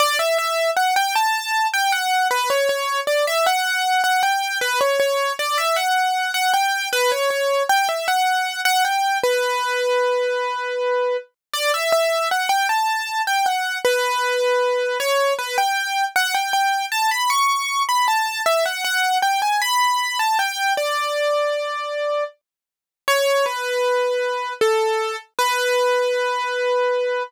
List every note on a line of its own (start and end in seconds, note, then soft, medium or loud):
0.00 0.18 D5 loud
0.19 0.38 E5 medium
0.38 0.71 E5 medium
0.77 0.95 F#5 medium
0.96 1.14 G5 medium
1.16 1.67 A5 medium
1.74 1.92 G5 medium
1.92 2.28 F#5 medium
2.31 2.49 B4 medium
2.50 2.68 C#5 medium
2.69 3.00 C#5 medium
3.07 3.25 D5 medium
3.27 3.46 E5 medium
3.46 4.02 F#5 medium
4.04 4.22 F#5 medium
4.23 4.58 G5 medium
4.61 4.79 B4 medium
4.81 4.99 C#5 medium
5.00 5.33 C#5 medium
5.39 5.57 D5 medium
5.58 5.76 E5 medium
5.76 6.31 F#5 medium
6.34 6.52 F#5 medium
6.54 6.89 G5 medium
6.93 7.11 B4 loud
7.12 7.30 C#5 medium
7.30 7.63 C#5 medium
7.69 7.88 G5 medium
7.89 8.07 E5 medium
8.08 8.61 F#5 medium
8.65 8.83 F#5 loud
8.85 9.18 G5 medium
9.23 11.17 B4 medium
11.54 11.72 D5 medium
11.74 11.92 E5 medium
11.92 12.29 E5 medium
12.31 12.50 F#5 medium
12.49 12.67 G5 medium
12.69 13.22 A5 medium
13.27 13.46 G5 medium
13.46 13.78 F#5 medium
13.85 14.98 B4 medium
15.00 15.33 C#5 medium
15.39 15.57 B4 medium
15.58 16.05 G5 medium
16.16 16.34 F#5 medium
16.34 16.53 G5 medium
16.53 16.86 G5 medium
16.92 17.10 A5 medium
17.11 17.30 B5 medium
17.30 17.83 C#6 medium
17.89 18.07 B5 medium
18.08 18.42 A5 medium
18.46 18.64 E5 medium
18.66 18.84 F#5 medium
18.84 19.18 F#5 medium
19.22 19.41 G5 medium
19.42 19.60 G#5 medium
19.62 20.18 B5 medium
20.19 20.38 A5 medium
20.39 20.73 G5 medium
20.77 22.24 D5 medium
23.08 23.45 C#5 medium
23.46 24.53 B4 medium
24.61 25.16 A4 medium
25.39 27.23 B4 medium